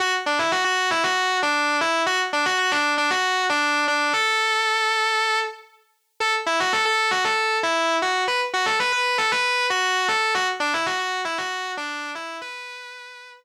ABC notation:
X:1
M:4/4
L:1/16
Q:1/4=116
K:Bdor
V:1 name="Distortion Guitar"
F z D E F F2 E F3 D3 E2 | F z D F F D2 D F3 D3 D2 | A10 z6 | A z E F A A2 F A3 E3 F2 |
B z F A B B2 A B3 F3 A2 | F z D E F F2 E F3 D3 E2 | B8 z8 |]